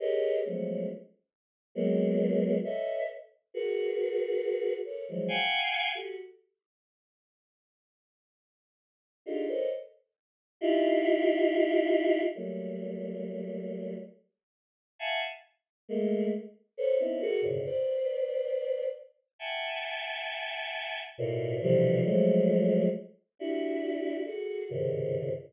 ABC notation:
X:1
M:6/4
L:1/16
Q:1/4=68
K:none
V:1 name="Choir Aahs"
[G^G^AB^c^d]2 [F,^F,^G,=A,B,^C]2 z4 [F,G,^A,B,]4 [=ABcde]2 z2 [^FG^AB]6 [=A^ABc] [E,=F,^F,G,] | [f^fg^g]3 [^F=GA] z14 [D^D=FG^GA] [A^ABc^c^d] z4 | [^DEFG]8 [^F,G,A,^A,]8 z4 [e=f^f^g=a] z3 | [^G,A,^A,]2 z2 [=ABc^c] [B,=C^C^DE] [^F^GA^A] [^F,,^G,,^A,,B,,^C,=D,] [B=cd]6 z2 [e^f=g^g=a]8 |
[A,,^A,,B,,]2 [B,,C,D,E,F,G,]2 [F,^F,^G,=A,]4 z2 [DE^F=G]4 [F^GA]2 [=G,,^G,,^A,,C,^C,^D,]3 z5 |]